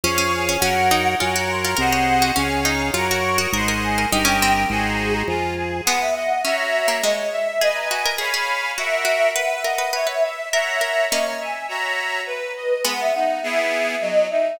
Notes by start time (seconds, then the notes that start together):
0.04 F2 C#4 G#4 C#5 F5 C#6
0.18 C#4
0.34 G#5
0.49 C#4
0.60 F#2 C#4 A#4 C#5 F#5
0.91 D#4
1.18 F#2 F4 A#4 C#5 F#5 G#5
1.36 F#4 A#5
1.49 C6
1.63 F4 A#5
1.77 C2 G#4 A#4 C5 D#5 F#5
1.92 C#5
2.22 F#4
2.36 C#2 C#4 G#4 C#5 F5 G#5
2.65 D#4 A#5
2.81 G#5
2.93 F#2 F4 A#4 C#5 F#5 A#5
3.09 F#4 C#6
3.24 C#6
3.38 F#4 D#6
3.53 G#1 G#4 A#4 C5 D#5 F#5 C6
3.68 A#4
3.83 G#5
3.98 A#4
4.11 G1 D#4 G4 A#4 D#5 G5
4.25 C#4
4.42 C4
4.70 G#1 F#4 G#4 C5 D#5 G#5
4.83 A#5
5.00 G#4
5.13 A#5
5.28 F2 F4 G#5
5.57 G#4
5.85 G#3 B3 B4 F#5
6.00 E5
6.15 D#5 F#5
6.42 C#4 F#4 C#5 E5 A#5
6.58 E5
6.72 E5
6.88 A#3
7.02 G#3 C#5 D#5
7.32 E5
7.60 G#4 B4 D#5 G#5
7.75 A#5
7.90 F#4 G#5
8.06 A#4
8.18 G#4 C#5 F5 G#5 B5
8.34 G#4
8.77 F#4 A#4 E5 F#5 C#6
9.05 F#4
9.35 B4 F#5
9.52 E5
9.62 A#4 D#5 F#5
9.78 B4
9.93 B4 C#5 E5
10.07 B4 E5
10.23 E5
10.52 A#4 C#5 E5 F#5 A#5
10.81 A#4 E5
11.10 A#3 C#4 C#5 D#5
11.26 A#5
11.40 E5 G#5
11.68 F#4 C#5 E5 A#5
12.26 B4
12.56 D#5
12.85 G#3 B3 F#5
13.00 E5
13.14 D#4 F#5
13.43 B3 E4 G#4 E5
13.59 E5
13.72 E5
14.01 F#3 D#5
14.30 D#4 E5